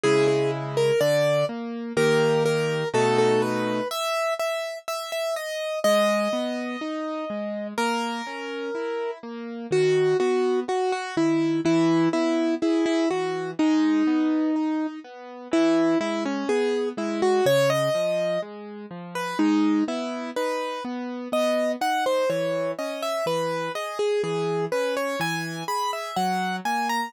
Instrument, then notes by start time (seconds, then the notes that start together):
acoustic grand piano
0.03 C#3 G#3 E4 G#4
0.28 G#4
0.77 A#4
1.00 D3 D5
1.49 A#3
1.97 D#3 A#3 G4 A#4
2.45 A#4
2.94 B2 A3 D#4 F#4 A4
3.18 A4
3.42 B4
3.91 E5
4.39 E5
4.88 E5
5.12 E5
5.36 D#5
5.84 G#3 D#5
6.33 B3
6.81 D#4
7.30 G#3
7.78 A#3 A#4
8.27 C#4
8.75 E4
9.23 A#3
9.71 D#3 F#4
10.20 B3 F#4
10.68 F#4
10.92 F#4
11.17 D#3 E4
11.65 E3 E4
12.13 B3 E4
12.62 E4 G#4
12.86 E4
13.10 E3 F#4
13.59 G#3 D#4
14.07 B3
14.56 D#4
15.04 B3
15.51 E3 E4
16.00 G#3 E4
16.25 C#4
16.49 B3 G#4
16.97 G#3 E4
17.22 F#4
17.46 C#3 C#5
17.70 D#5
17.95 F3
18.42 G#3
18.91 F3
19.15 B4
19.39 G#3 D#4
19.88 B3 E4
20.36 D#4 B4
20.84 B3
21.32 B3 D#5
21.81 D#4 F#5
22.06 C5
22.30 E3 C#5
22.79 C#4 D#5
23.02 E5
23.26 E3 B4
23.75 G#4 D#5
23.99 G#4
24.23 E3 G#4
24.72 C#4 B4
24.97 C#5
25.20 E3 G#5
25.68 G#4 B5
25.93 E5
26.16 F#3 F#5
26.65 A#3 G#5
26.89 A#5